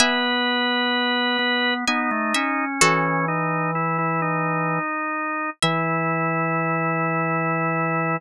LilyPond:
<<
  \new Staff \with { instrumentName = "Pizzicato Strings" } { \time 3/4 \key e \major \tempo 4 = 64 <e'' gis''>2 gis''8 e''8 | <fis' a'>2 r4 | e''2. | }
  \new Staff \with { instrumentName = "Drawbar Organ" } { \time 3/4 \key e \major b'2 dis'4 | cis'8 dis'8 e'16 e'16 dis'4. | e'2. | }
  \new Staff \with { instrumentName = "Drawbar Organ" } { \time 3/4 \key e \major b4. b8 b16 a16 cis'8 | e2~ e8 r8 | e2. | }
>>